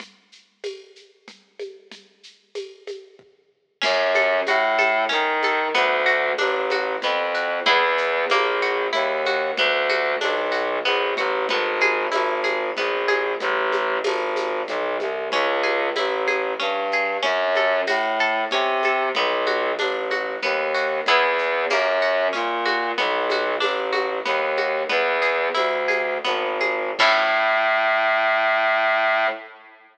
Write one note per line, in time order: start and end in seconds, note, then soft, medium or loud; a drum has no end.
0.00 low conga medium
0.00 shaker medium
0.32 shaker medium
0.64 tambourine medium
0.64 high conga medium
0.64 shaker medium
0.96 shaker medium
1.28 low conga medium
1.28 shaker medium
1.59 high conga medium
1.59 shaker medium
1.91 low conga medium
1.91 shaker medium
2.23 shaker medium
2.55 tambourine medium
2.55 high conga medium
2.55 shaker medium
2.87 high conga medium
2.87 shaker medium
3.19 kick medium
3.81 4.40 F#2 medium
3.81 4.10 C#4 medium
3.81 crash loud
3.81 low conga loud
3.81 shaker medium
4.15 4.44 A4 medium
4.15 high conga medium
4.15 shaker medium
4.47 5.04 A2 medium
4.47 4.77 F#4 medium
4.47 tambourine medium
4.47 high conga medium
4.47 shaker medium
4.78 5.07 A4 medium
4.78 high conga medium
4.78 shaker medium
5.09 5.68 D#3 medium
5.09 5.38 C#4 medium
5.09 low conga medium
5.09 shaker medium
5.42 5.73 A4 medium
5.42 high conga medium
5.42 shaker medium
5.74 6.32 D2 medium
5.74 6.03 B3 loud
5.74 low conga medium
5.74 shaker medium
6.06 6.35 F#4 medium
6.06 shaker medium
6.38 6.96 A1 medium
6.38 6.67 D4 medium
6.38 tambourine medium
6.38 high conga medium
6.38 shaker medium
6.70 7.00 F#4 medium
6.70 high conga medium
6.70 shaker medium
7.02 7.60 F2 medium
7.02 7.32 B3 medium
7.02 low conga medium
7.02 shaker medium
7.34 7.63 F#4 medium
7.34 shaker medium
7.66 8.25 E2 medium
7.66 8.23 B3 medium
7.66 8.23 E4 medium
7.66 8.23 G#4 medium
7.66 low conga loud
7.66 shaker medium
7.98 shaker medium
8.30 8.87 A#1 medium
8.30 8.60 A#3 loud
8.30 tambourine medium
8.30 high conga medium
8.30 shaker medium
8.62 8.91 F#4 medium
8.62 shaker medium
8.93 9.51 D#2 medium
8.93 9.21 E4 medium
8.93 low conga medium
8.93 shaker medium
9.26 9.55 F#4 medium
9.26 high conga medium
9.26 shaker medium
9.57 10.15 D2 medium
9.57 9.87 B3 medium
9.57 low conga loud
9.57 shaker medium
9.89 10.18 F#4 medium
9.89 high conga medium
9.89 shaker medium
10.21 10.79 B1 medium
10.21 10.49 D4 medium
10.21 tambourine medium
10.21 high conga medium
10.21 shaker medium
10.52 10.80 F#4 medium
10.52 shaker medium
10.85 11.14 A#1 medium
10.85 11.14 B3 medium
10.85 shaker medium
11.17 11.46 A1 medium
11.17 11.46 F#4 medium
11.17 low conga medium
11.17 shaker medium
11.49 12.06 G#1 medium
11.49 11.79 B3 medium
11.49 low conga loud
11.49 shaker medium
11.81 12.10 G#4 medium
11.81 high conga medium
11.81 shaker medium
12.11 12.70 G#1 medium
12.11 12.40 E4 medium
12.11 tambourine medium
12.11 high conga medium
12.11 shaker medium
12.44 12.72 G#4 medium
12.44 high conga medium
12.44 shaker medium
12.77 13.34 A#1 medium
12.77 13.06 B3 medium
12.77 low conga medium
12.77 shaker medium
13.08 13.37 G#4 medium
13.08 high conga medium
13.08 shaker medium
13.40 13.98 A1 medium
13.40 low conga medium
13.40 shaker medium
13.72 high conga medium
13.72 shaker medium
14.04 14.62 G#1 medium
14.04 tambourine loud
14.04 high conga medium
14.04 shaker medium
14.36 high conga medium
14.36 shaker medium
14.68 14.97 B1 medium
14.68 low conga medium
14.68 shaker medium
15.00 15.29 C2 medium
15.00 high conga medium
15.00 shaker medium
15.32 15.89 C#2 medium
15.32 15.61 C#4 medium
15.32 low conga medium
15.32 shaker medium
15.63 15.92 G#4 medium
15.63 high conga medium
15.63 shaker medium
15.96 16.53 A1 medium
15.96 16.25 E4 medium
15.96 tambourine medium
15.96 high conga medium
15.96 shaker medium
16.27 16.56 G#4 medium
16.27 high conga medium
16.27 shaker medium
16.59 17.17 G2 medium
16.59 16.88 C#4 medium
16.59 low conga medium
16.59 shaker medium
16.91 17.22 G#4 medium
16.91 shaker medium
17.22 17.81 F#2 medium
17.22 17.51 C#4 medium
17.22 low conga medium
17.22 shaker medium
17.55 17.85 A4 medium
17.55 high conga medium
17.55 shaker medium
17.87 18.45 A2 medium
17.87 18.16 F#4 medium
17.87 tambourine medium
17.87 high conga medium
17.87 shaker medium
18.19 18.49 A4 medium
18.19 shaker medium
18.51 19.09 C3 medium
18.51 18.81 C#4 medium
18.51 low conga medium
18.51 shaker medium
18.83 19.13 A4 medium
18.83 high conga medium
18.83 shaker medium
19.15 19.72 B1 medium
19.15 19.45 B3 medium
19.15 low conga loud
19.15 shaker medium
19.47 19.75 F#4 medium
19.47 high conga medium
19.47 shaker medium
19.79 20.36 A1 medium
19.79 20.08 D4 medium
19.79 tambourine medium
19.79 high conga medium
19.79 shaker medium
20.11 20.40 F#4 medium
20.11 high conga medium
20.11 shaker medium
20.43 21.00 D#2 medium
20.43 20.72 B3 medium
20.43 low conga medium
20.43 shaker medium
20.74 21.03 F#4 medium
20.74 shaker medium
21.06 21.65 E2 medium
21.06 21.65 B3 medium
21.06 21.65 E4 medium
21.06 21.65 G#4 medium
21.06 low conga medium
21.06 shaker medium
21.38 shaker medium
21.70 22.28 F#2 medium
21.70 21.99 A#3 medium
21.70 tambourine medium
21.70 high conga medium
21.70 shaker medium
22.02 22.31 F#4 medium
22.02 shaker medium
22.33 22.91 A#2 medium
22.33 22.61 C#4 medium
22.33 low conga medium
22.33 shaker medium
22.65 22.94 F#4 medium
22.65 high conga medium
22.65 shaker medium
22.98 23.55 B1 medium
22.98 23.26 B3 medium
22.98 low conga loud
22.98 shaker medium
23.30 23.60 F#4 medium
23.30 high conga medium
23.30 shaker medium
23.60 24.19 A1 medium
23.60 23.89 D4 medium
23.60 tambourine medium
23.60 high conga medium
23.60 shaker medium
23.92 24.21 F#4 medium
23.92 high conga medium
23.92 shaker medium
24.25 24.83 D#2 medium
24.25 24.54 B3 medium
24.25 low conga medium
24.25 shaker medium
24.57 24.87 F#4 medium
24.57 high conga medium
24.57 shaker medium
24.89 25.48 E2 medium
24.89 25.18 B3 medium
24.89 low conga medium
24.89 shaker medium
25.22 25.52 G#4 medium
25.22 shaker medium
25.54 26.18 D2 medium
25.54 25.85 E4 medium
25.54 tambourine medium
25.54 high conga medium
25.54 shaker medium
25.88 26.20 G#4 medium
25.88 high conga medium
25.88 shaker medium
26.24 26.91 G#1 medium
26.24 26.57 B3 medium
26.24 low conga medium
26.24 shaker medium
26.61 26.94 G#4 medium
26.61 high conga medium
26.61 shaker medium
26.99 29.27 A2 loud
26.99 29.28 C#4 loud
26.99 29.28 E4 medium
26.99 29.28 A4 medium
26.99 kick loud
26.99 crash loud